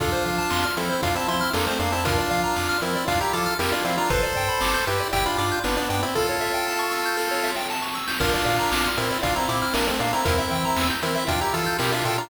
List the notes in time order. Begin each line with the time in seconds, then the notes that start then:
0.00 F2 D4 F4 A4, kick, closed hi-hat
0.12 C5
0.25 F3 F5, closed hi-hat
0.38 A5
0.50 F2 C6, snare
0.64 F6
0.77 F3 C4 E4 A4, closed hi-hat
0.90 C5
1.02 F2 D4 F4 F5, kick, closed hi-hat
1.15 C4 E4 A5
1.28 F3 C4 E4 C6, closed hi-hat
1.41 F6
1.53 F2 A#3 D4 A4, snare
1.67 A3 C4 C5
1.79 F2 A#3 D4 F5, closed hi-hat
1.92 C4 E4 A5
2.05 D4 F4 A#4, kick, closed hi-hat
2.18 D5
2.30 F3 F5, closed hi-hat
2.43 A#5
2.56 F2 D6, snare
2.69 F6
2.80 F3 C4 E4 A#4, closed hi-hat
2.95 D5
3.08 F2 D4 F4 F5, kick, closed hi-hat
3.21 E4 G4 A#5
3.33 F3 F4 A4 D6, closed hi-hat
3.46 F6
3.59 F2 E4 G4 A#4, snare
3.72 D4 F4 D5
3.85 F3 C4 E4 F5, closed hi-hat
3.97 D4 F4 A#5
4.10 G1 A4 B4 C5, kick, closed hi-hat
4.23 D5
4.36 G2 G5, closed hi-hat
4.49 B5
4.61 G1 D6, snare
4.74 G6
4.86 G2 E4 G4 B4, closed hi-hat
5.00 D5
5.13 G1 E4 G4 G5, kick, closed hi-hat
5.26 D4 F4 B5
5.38 G2 D4 F4 D6, closed hi-hat
5.51 G6
5.64 G1 B3 D4 B4, snare
5.77 B3 D4 D5
5.90 G2 B3 D4 G5, closed hi-hat
6.03 C4 E4 B5
6.15 F4 A4, kick, snare
6.29 C#5
6.41 E5, snare
6.54 G5
6.67 A5, snare
6.79 C#6
6.92 E6, snare
7.05 G6
7.17 A4, snare
7.31 C#5, snare
7.43 E5, snare
7.55 G5, snare
7.70 A5, snare
7.82 C#6, snare
7.94 E6, snare
8.07 G6, snare
8.20 A#1 D4 F4 A#4, kick, crash
8.33 D5
8.45 A#2 F5, closed hi-hat
8.59 A#5
8.71 A#1 D6, snare
8.85 F6
8.96 A#2 C4 E4 A#4, closed hi-hat
9.10 D5
9.23 A#1 D4 F4 F5, kick, closed hi-hat
9.35 C4 E4 A#5
9.48 A#2 C4 E4 D6, closed hi-hat
9.62 F6
9.74 A#1 A#3 D4 A#4, snare
9.87 A3 C4 D5
10.00 A#2 A#3 D4 F5, closed hi-hat
10.13 C4 E4 A#5
10.25 E2 C4 E4 A#4, kick, closed hi-hat
10.38 E5
10.50 E3 G5, closed hi-hat
10.65 A#5
10.76 E2 E6, snare
10.90 G6
11.02 E3 C4 E4 A#4, closed hi-hat
11.15 E5
11.27 E2 D4 F4 G5, kick, closed hi-hat
11.41 E4 G4 A#5
11.54 E3 F4 A4 E6, closed hi-hat
11.66 G6
11.79 B2 E4 G4 A#4, snare
11.92 D4 F4 E5
12.05 A#2 F4 A4 G5, closed hi-hat
12.18 D4 F4 A#5